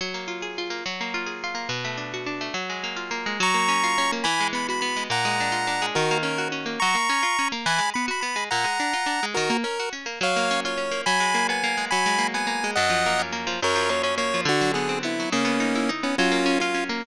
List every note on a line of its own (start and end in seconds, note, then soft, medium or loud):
0.01 0.82 F#3 medium
0.14 0.70 A#3 medium
0.28 0.58 F4 medium
0.42 0.83 G#4 medium
0.58 0.85 F4 medium
0.70 0.84 A#3 medium
0.86 1.66 F#3 medium
1.01 1.54 A#3 medium
1.14 1.43 F4 medium
1.26 1.67 G#4 medium
1.44 1.71 F4 medium
1.55 1.68 A#3 medium
1.69 2.50 B2 medium
1.84 2.40 A3 medium
1.97 2.26 D4 medium
2.14 2.54 F#4 medium
2.26 2.53 D4 medium
2.41 2.54 A3 medium
2.54 3.35 F#3 medium
2.70 3.26 G#3 medium
2.84 3.10 A#3 medium
2.96 3.37 F4 medium
3.11 3.38 A#3 medium
3.26 3.40 G#3 medium
3.40 4.21 F#3 loud
3.40 4.11 A#5 medium
3.40 4.11 C#6 medium
3.54 4.12 A#3 medium
3.68 3.97 C#4 medium
3.84 4.24 F4 medium
3.98 4.25 C#4 loud
4.12 4.26 A#3 medium
4.24 5.05 E3 loud
4.24 4.48 G#5 medium
4.24 4.48 B5 medium
4.40 4.96 G#3 medium
4.53 4.81 B3 medium
4.53 4.67 B5 medium
4.69 5.09 F#4 medium
4.69 4.80 B5 medium
4.81 5.09 B3 medium
4.81 5.04 B5 medium
4.96 5.10 G#3 medium
5.10 5.91 A#2 loud
5.10 5.86 F#5 medium
5.10 5.86 A#5 medium
5.25 5.81 G#3 medium
5.40 5.67 D4 medium
5.52 5.92 F4 medium
5.67 5.94 D4 medium
5.82 5.95 G#3 medium
5.95 6.77 D#3 loud
5.95 6.18 F#4 medium
5.95 6.18 A#4 medium
6.11 6.65 A#3 loud
6.23 6.51 C#4 medium
6.23 6.48 A#4 medium
6.38 6.79 F#4 medium
6.52 6.79 C#4 medium
6.66 6.79 A#3 medium
6.80 6.96 F#3 loud
6.80 7.48 A#5 medium
6.80 7.48 C#6 medium
6.95 7.09 A#3 medium
7.09 7.24 C#4 medium
7.23 7.37 F4 medium
7.39 7.53 C#4 loud
7.52 7.65 A#3 medium
7.66 7.80 E3 loud
7.66 7.90 G#5 medium
7.66 7.90 B5 medium
7.78 7.93 G#3 medium
7.94 8.10 B3 medium
7.94 8.06 B5 medium
8.08 8.22 F#4 medium
8.08 8.21 B5 medium
8.21 8.37 B3 medium
8.21 8.44 B5 medium
8.36 8.49 G#3 medium
8.51 8.66 A#2 loud
8.51 9.26 F#5 medium
8.51 9.26 A#5 medium
8.64 8.78 G#3 medium
8.80 8.94 D4 medium
8.93 9.08 F4 medium
9.06 9.21 D4 medium
9.23 9.36 G#3 medium
9.34 9.51 D#3 loud
9.34 9.57 F#4 medium
9.34 9.57 A#4 medium
9.50 9.64 A#3 loud
9.64 9.78 C#4 medium
9.64 9.89 A#4 medium
9.79 9.94 F#4 medium
9.93 10.07 C#4 medium
10.06 10.19 A#3 medium
10.21 11.02 F#3 loud
10.21 10.60 C#5 medium
10.21 10.60 F5 medium
10.36 10.91 A#3 medium
10.51 10.77 C#4 medium
10.65 11.05 F4 medium
10.65 11.02 C#5 medium
10.77 11.04 C#4 medium
10.91 11.05 A#3 medium
11.06 11.87 F#3 loud
11.06 11.47 G#5 medium
11.06 11.47 B5 medium
11.20 11.77 G#3 medium
11.34 11.63 A#3 medium
11.49 11.89 B3 medium
11.49 11.85 G#5 medium
11.64 11.90 A#3 medium
11.77 11.91 G#3 medium
11.91 12.73 F#3 loud
11.91 12.27 G#5 medium
11.91 12.27 B5 medium
12.06 12.63 G#3 medium
12.18 12.46 A#3 medium
12.34 12.74 B3 medium
12.34 12.71 G#5 medium
12.47 12.74 A#3 medium
12.64 12.77 G#3 medium
12.75 13.58 F#2 loud
12.75 13.22 D#5 medium
12.75 13.22 F#5 medium
12.90 13.46 F3 medium
13.06 13.32 A#3 medium
13.19 13.60 C#4 medium
13.32 13.59 A#3 medium
13.47 13.60 F3 medium
13.62 14.43 F#2 loud
13.62 13.90 A#4 medium
13.62 13.90 C#5 medium
13.75 14.33 F3 medium
13.89 14.17 A#3 medium
13.89 14.02 C#5 medium
14.03 14.44 C#4 medium
14.03 14.15 C#5 medium
14.18 14.45 A#3 medium
14.18 14.41 C#5 medium
14.34 14.47 F3 medium
14.45 15.26 D3 loud
14.45 14.72 D4 medium
14.45 14.72 F#4 medium
14.61 15.19 F#3 medium
14.74 15.02 B3 medium
14.74 14.99 G#4 medium
14.89 15.29 C4 medium
15.03 15.30 B3 medium
15.03 15.30 E4 medium
15.20 15.33 F#3 medium
15.32 16.13 C#3 loud
15.32 15.91 A#3 medium
15.32 15.91 C#4 medium
15.45 16.03 B3 medium
15.60 15.89 D#4 medium
15.75 16.16 E4 medium
15.89 16.16 D#4 medium
16.03 16.17 B3 medium
16.03 16.16 C#4 medium
16.18 17.00 F#3 loud
16.18 16.59 C#4 medium
16.18 16.59 F4 medium
16.32 16.89 A#3 medium
16.46 16.74 C#4 medium
16.60 16.84 F4 medium
16.60 17.02 F4 medium
16.74 17.01 C#4 medium
16.89 17.03 A#3 medium